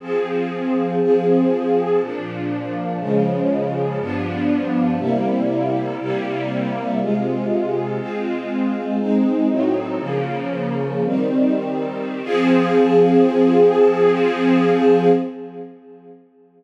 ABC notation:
X:1
M:4/4
L:1/8
Q:1/4=120
K:Fm
V:1 name="String Ensemble 1"
[F,CA]4 [F,CA]4 | [B,,F,=D]4 [_D,F,A,]4 | [G,,F,=B,=D]4 [C,G,_B,=E]4 | [C,G,B,=E]4 [C,A,F]4 |
[A,CF]4 [A,CE]2 [=A,,_G,CE]2 | "^rit." [D,F,B,]4 [E,G,C]4 | [F,CA]8 |]